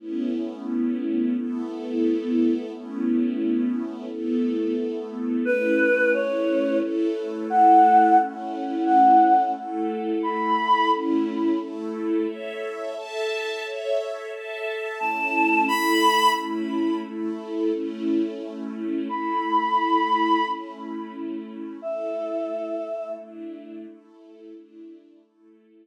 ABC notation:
X:1
M:6/8
L:1/8
Q:3/8=88
K:A
V:1 name="Choir Aahs"
z6 | z6 | z6 | z6 |
B3 c3 | z3 f3 | z3 f3 | z3 b3 |
z6 | z6 | z6 | a3 b3 |
z6 | z6 | b6 | z6 |
e6 | z6 | z6 |]
V:2 name="String Ensemble 1"
[A,B,CE]6 | [A,B,EA]6 | [A,B,CE]6 | [A,B,EA]6 |
[A,CE]6 | [A,EA]6 | [A,CE]6 | [A,EA]6 |
[A,CE]3 [A,EA]3 | [Ace]3 [Aea]3 | [Ace]3 [Aea]3 | [A,CE]3 [A,EA]3 |
[A,CE]3 [A,EA]3 | [A,CE]6 | [A,EA]6 | [A,CE]6 |
[A,EA]6 | [A,DE]3 [A,EA]3 | [A,DE]3 [A,EA]3 |]